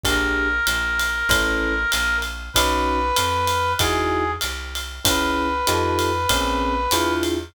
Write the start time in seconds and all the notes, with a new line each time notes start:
0.04 A#1 D4 G4 G#4 A#4, kick, ride
0.67 A#1, hi-hat pedal, ride
0.99 ride
1.29 A1 C#4 E4 A4 B4, kick, ride
1.92 A#1, hi-hat pedal, ride
2.22 ride
2.54 B1 C#4 D#4 F#4 B4, kick, ride
3.17 F2, hi-hat pedal, ride
3.48 ride
3.79 E2 D#4 E4 F#4 G#4, kick, ride
4.41 C2, hi-hat pedal, ride
4.75 ride
5.05 C#2 C#4 E4 G#4 B4, kick, ride
5.67 F2 D#4 F4 G4 A4, hi-hat pedal, ride
5.99 ride
6.29 A#1 C4 C#4 G#4 A#4, kick, ride
6.91 E2 D4 E4 F4 G#4, hi-hat pedal, ride
7.23 ride